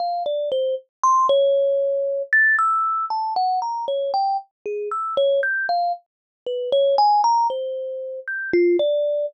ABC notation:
X:1
M:9/8
L:1/16
Q:3/8=39
K:none
V:1 name="Kalimba"
f d c z c' ^c4 a' e'2 a ^f ^a c g z | ^G e' ^c =g' f z2 B c ^g ^a =c3 =g' F d2 |]